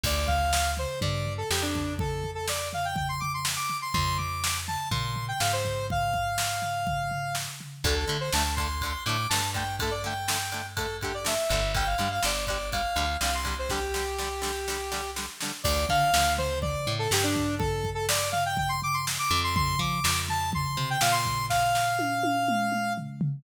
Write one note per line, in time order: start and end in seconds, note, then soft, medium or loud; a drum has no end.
0.03 0.86 D2 medium
0.03 0.27 D5 loud
0.03 kick loud
0.03 crash loud
0.27 0.71 F5 loud
0.27 kick loud
0.27 floor tom medium
0.53 snare loud
0.77 0.99 C5 loud
0.77 floor tom medium
1.01 1.43 G2 medium
1.01 1.33 D5 medium
1.01 kick loud
1.01 floor tom loud
1.26 floor tom medium
1.38 1.49 A4 loud
1.50 3.58 F2 medium
1.50 1.62 G4 loud
1.50 snare loud
1.62 1.94 D4 loud
1.75 kick medium
1.75 floor tom medium
1.99 2.30 A4 loud
1.99 kick loud
1.99 floor tom loud
2.24 floor tom medium
2.35 2.46 A4 medium
2.48 2.69 D5 medium
2.48 snare loud
2.73 2.85 F5 medium
2.73 floor tom medium
2.85 2.96 G5 loud
2.96 3.08 G5 medium
2.96 kick medium
2.96 floor tom loud
3.09 3.20 C6 loud
3.20 3.32 D6 loud
3.20 floor tom medium
3.34 3.45 C6 medium
3.45 snare loud
3.56 3.77 D6 loud
3.70 floor tom medium
3.82 3.93 C6 loud
3.93 4.77 F2 medium
3.93 4.17 C6 loud
3.93 kick loud
3.93 floor tom loud
4.17 4.57 D6 medium
4.17 floor tom medium
4.44 snare loud
4.68 4.89 A5 loud
4.68 floor tom medium
4.91 5.33 A#2 medium
4.91 5.26 C6 medium
4.91 kick loud
4.91 floor tom loud
5.16 floor tom medium
5.28 5.40 G5 loud
5.40 7.48 G#2 medium
5.40 5.52 F5 loud
5.40 snare loud
5.53 5.86 C5 loud
5.65 kick medium
5.65 floor tom medium
5.90 7.34 F5 loud
5.90 kick loud
5.90 floor tom loud
6.14 kick medium
6.14 floor tom medium
6.38 snare loud
6.62 floor tom medium
6.87 kick medium
6.87 floor tom loud
7.11 floor tom medium
7.35 snare loud
7.60 floor tom medium
7.84 8.05 D2 medium
7.84 7.94 D3 loud
7.84 7.94 A3 loud
7.84 7.95 A4 loud
7.84 kick loud
7.84 ride loud
7.96 8.17 A4 medium
8.08 8.17 D3 medium
8.08 8.30 D3 medium
8.08 8.17 A3 medium
8.08 ride medium
8.20 8.32 C5 loud
8.33 8.95 D2 medium
8.33 8.43 D3 medium
8.33 8.43 A3 medium
8.33 8.54 A5 loud
8.33 snare loud
8.56 8.68 D3 medium
8.56 8.68 A3 medium
8.56 9.03 C6 loud
8.56 kick medium
8.56 ride medium
8.81 8.93 D3 medium
8.81 8.93 A3 medium
8.81 kick medium
8.81 ride loud
9.06 9.27 A2 medium
9.06 9.17 D3 medium
9.06 9.17 A3 medium
9.06 9.28 D6 medium
9.06 ride medium
9.29 11.38 G2 medium
9.29 9.41 D3 medium
9.29 9.41 A3 medium
9.29 9.50 A5 medium
9.29 snare loud
9.54 9.64 D3 medium
9.54 9.64 A3 medium
9.54 9.76 G5 medium
9.54 kick medium
9.54 ride medium
9.79 9.90 D3 medium
9.79 9.90 A3 medium
9.79 9.93 A4 loud
9.79 kick loud
9.79 ride loud
9.91 10.02 D5 medium
10.04 10.14 D3 medium
10.04 10.14 A3 medium
10.04 10.66 G5 medium
10.04 ride medium
10.28 10.38 D3 medium
10.28 10.38 A3 medium
10.28 snare loud
10.52 10.62 D3 medium
10.52 10.62 A3 medium
10.52 ride medium
10.77 10.86 D3 medium
10.77 10.86 A3 medium
10.77 10.97 A4 medium
10.77 kick medium
10.77 ride loud
11.01 11.12 D3 medium
11.01 11.12 A3 medium
11.01 11.14 G4 medium
11.01 kick medium
11.01 ride medium
11.14 11.26 D5 medium
11.24 11.34 D3 medium
11.24 11.34 A3 medium
11.24 11.72 E5 medium
11.24 snare loud
11.49 11.95 G1 medium
11.49 11.61 D3 medium
11.49 11.61 A3 medium
11.49 kick medium
11.49 ride medium
11.74 11.84 D3 medium
11.74 11.84 G3 medium
11.74 11.87 G5 loud
11.74 kick loud
11.74 ride loud
11.86 12.09 F5 medium
11.98 12.20 G2 medium
11.98 12.08 D3 medium
11.98 12.08 G3 medium
11.98 ride medium
12.11 12.23 F5 loud
12.23 12.86 G1 medium
12.23 12.33 D3 medium
12.23 12.33 G3 medium
12.23 12.45 D5 medium
12.23 snare loud
12.47 12.58 D3 medium
12.47 12.58 G3 medium
12.47 12.70 D5 medium
12.47 kick medium
12.47 ride medium
12.72 12.82 D3 medium
12.72 12.82 G3 medium
12.72 13.17 F5 medium
12.72 kick medium
12.72 ride loud
12.96 13.17 D2 medium
12.96 13.05 D3 medium
12.96 13.05 G3 medium
12.96 ride medium
13.21 15.28 C2 medium
13.21 13.31 D3 medium
13.21 13.31 G3 medium
13.21 13.34 F5 medium
13.21 snare loud
13.34 13.56 C6 medium
13.45 13.54 D3 medium
13.45 13.54 G3 medium
13.45 kick medium
13.45 ride medium
13.59 13.70 C5 medium
13.69 13.80 D3 medium
13.69 13.80 G3 medium
13.69 15.10 G4 loud
13.69 kick medium
13.69 snare medium
13.94 14.04 D3 medium
13.94 14.04 G3 medium
13.94 snare medium
14.18 14.29 D3 medium
14.18 14.29 G3 medium
14.18 snare medium
14.42 14.51 D3 medium
14.42 14.51 G3 medium
14.42 snare medium
14.68 14.78 D3 medium
14.68 14.78 G3 medium
14.68 snare medium
14.92 15.01 D3 medium
14.92 15.01 G3 medium
14.92 snare medium
15.16 15.26 D3 medium
15.16 15.26 G3 medium
15.16 snare medium
15.40 15.52 D3 medium
15.40 15.52 G3 medium
15.40 snare medium
15.64 15.86 D2 medium
15.64 15.85 D5 loud
15.64 kick loud
15.64 crash loud
15.89 16.10 D3 medium
15.89 16.33 F5 loud
15.89 kick medium
15.89 floor tom medium
16.14 16.76 D2 medium
16.14 snare loud
16.38 16.59 C5 loud
16.38 floor tom medium
16.62 16.93 D5 loud
16.62 kick medium
16.62 floor tom loud
16.87 17.08 A2 medium
16.87 floor tom medium
16.99 17.10 A4 loud
17.11 19.18 G2 medium
17.11 17.24 G4 loud
17.11 snare loud
17.23 17.55 D4 loud
17.35 kick medium
17.35 floor tom medium
17.59 17.90 A4 loud
17.59 kick loud
17.59 floor tom loud
17.84 kick medium
17.84 floor tom medium
17.95 18.06 A4 loud
18.09 18.29 D5 loud
18.09 snare loud
18.32 18.43 F5 loud
18.32 floor tom medium
18.46 18.57 G5 loud
18.57 18.69 G5 loud
18.57 kick loud
18.57 floor tom loud
18.69 18.80 C6 loud
18.82 18.95 D6 loud
18.82 floor tom medium
18.94 19.05 C6 loud
19.07 snare loud
19.19 19.40 D6 loud
19.31 19.76 F2 loud
19.31 floor tom medium
19.44 19.55 C6 loud
19.55 19.79 C6 loud
19.55 kick loud
19.55 floor tom loud
19.79 20.00 F3 medium
19.79 20.20 D6 loud
19.79 kick medium
19.79 floor tom medium
20.04 20.66 F2 medium
20.04 snare loud
20.28 20.50 A5 loud
20.28 floor tom medium
20.52 20.89 C6 loud
20.52 kick medium
20.52 floor tom loud
20.77 20.98 C3 medium
20.77 floor tom medium
20.90 21.02 G5 loud
21.01 23.09 A#2 medium
21.01 21.13 F5 loud
21.01 snare loud
21.12 21.46 C6 loud
21.25 kick medium
21.25 floor tom medium
21.50 22.93 F5 loud
21.50 kick medium
21.50 snare medium
21.75 snare medium
21.99 high tom medium
22.23 high tom loud
22.48 mid tom loud
22.72 mid tom medium
22.98 floor tom medium
23.21 floor tom loud